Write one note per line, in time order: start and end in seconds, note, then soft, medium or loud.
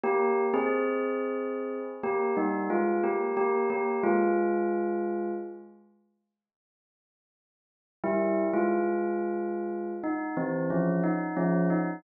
0.04 0.44 A#3 loud
0.04 0.44 G4 loud
0.54 1.79 C4 loud
0.54 1.79 G#4 loud
2.04 2.35 A#3 medium
2.04 2.35 G4 loud
2.37 2.69 G3 medium
2.37 2.69 D#4 loud
2.70 3.02 G#3 medium
2.70 3.02 F4 loud
3.04 3.35 A#3 medium
3.04 3.35 G4 medium
3.37 3.69 A#3 medium
3.37 3.69 G4 loud
3.70 4.02 A#3 medium
3.70 4.02 G4 medium
4.03 5.31 G#3 loud
4.03 5.31 F4 loud
8.04 8.45 G3 loud
8.04 8.45 E4 loud
8.54 9.92 G#3 medium
8.54 9.92 F4 loud
10.04 10.35 D#4 loud
10.37 10.69 E3 medium
10.37 10.69 C4 loud
10.70 11.02 F3 medium
10.70 11.02 C#4 medium
11.04 11.35 D#4 loud
11.37 11.68 F3 loud
11.37 11.68 C#4 loud
11.70 12.02 D#4 loud